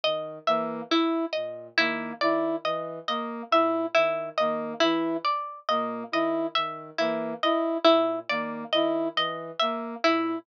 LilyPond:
<<
  \new Staff \with { instrumentName = "Ocarina" } { \clef bass \time 6/4 \tempo 4 = 69 dis8 e8 r8 ais,8 dis8 dis8 e8 r8 ais,8 dis8 dis8 e8 | r8 ais,8 dis8 dis8 e8 r8 ais,8 dis8 dis8 e8 r8 ais,8 | }
  \new Staff \with { instrumentName = "Brass Section" } { \time 6/4 r8 ais8 e'8 r8 ais8 e'8 r8 ais8 e'8 r8 ais8 e'8 | r8 ais8 e'8 r8 ais8 e'8 r8 ais8 e'8 r8 ais8 e'8 | }
  \new Staff \with { instrumentName = "Harpsichord" } { \time 6/4 dis''8 e''8 e'8 dis''8 e'8 d''8 dis''8 dis''8 e''8 e'8 dis''8 e'8 | d''8 dis''8 dis''8 e''8 e'8 dis''8 e'8 d''8 dis''8 dis''8 e''8 e'8 | }
>>